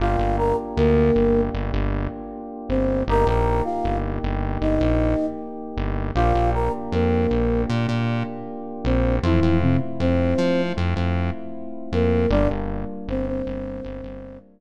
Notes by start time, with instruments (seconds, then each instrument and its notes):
0.00 synth bass 1 G1, electric piano 2 A#3 D4 F4 G4, flute F4 F5
0.19 synth bass 1 G1
0.38 flute A#4 A#5
0.77 synth bass 1 D2, flute A#3 A#4
1.16 synth bass 1 G1
1.54 synth bass 1 G1
1.73 synth bass 1 G1
2.69 synth bass 1 G1, flute C4 C5
3.08 synth bass 1 G1, electric piano 2 A#3 D#4 G4, flute A#4 A#5
3.27 synth bass 1 A#1, flute A#4 A#5
3.64 flute F4 F5
3.84 synth bass 1 G1
4.23 synth bass 1 G1
4.61 synth bass 1 G1, flute D#4 D#5
4.81 synth bass 1 A#1
5.77 synth bass 1 G1
6.15 synth bass 1 A#1, electric piano 2 A#3 D4 F4 G4, flute F4 F5
6.35 synth bass 1 A#1
6.54 flute A#4 A#5
6.92 synth bass 1 F2, flute A#3 A#4
7.31 synth bass 1 A#1
7.69 synth bass 1 A#2
7.89 synth bass 1 A#2
8.84 synth bass 1 A#1, flute C4 C5
9.23 synth bass 1 F2, flute E3 E4, electric piano 2 A3 C4 E4 F4
9.42 synth bass 1 F2
9.61 flute C3 C4
10.00 synth bass 1 F2, flute C4 C5
10.38 synth bass 1 F3
10.77 synth bass 1 F2
10.96 synth bass 1 F2
11.92 synth bass 1 F2, flute A#3 A#4
12.30 synth bass 1 G1, electric piano 2 G3 A#3 D4 F4, flute D4 D5
12.50 synth bass 1 G1
13.08 synth bass 1 G1, flute C4 C5
13.27 flute C4 C5
13.46 synth bass 1 G1
13.84 synth bass 1 G1
14.04 synth bass 1 G1